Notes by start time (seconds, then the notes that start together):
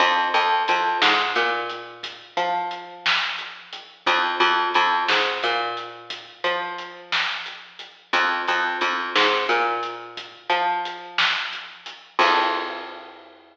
0.00 F2, kick, closed hi-hat
0.34 F2, closed hi-hat
0.68 F2, closed hi-hat
1.02 G#2, snare
1.35 A#2, closed hi-hat
1.69 closed hi-hat
2.03 kick, closed hi-hat
2.37 F3, closed hi-hat
2.71 closed hi-hat
3.06 snare
3.38 closed hi-hat
3.73 closed hi-hat
4.06 F2, kick, closed hi-hat
4.40 F2, closed hi-hat
4.74 F2, closed hi-hat
5.08 G#2, snare
5.43 A#2, closed hi-hat
5.77 closed hi-hat
6.10 kick, closed hi-hat
6.44 F3, closed hi-hat
6.78 closed hi-hat
7.12 snare
7.46 closed hi-hat
7.79 closed hi-hat
8.13 F2, kick, closed hi-hat
8.48 F2, closed hi-hat
8.81 F2, closed hi-hat
9.16 G#2, snare
9.49 A#2, closed hi-hat
9.83 closed hi-hat
10.17 kick, closed hi-hat
10.50 F3, closed hi-hat
10.85 closed hi-hat
11.18 snare
11.53 closed hi-hat
11.86 closed hi-hat
12.19 F2, kick, crash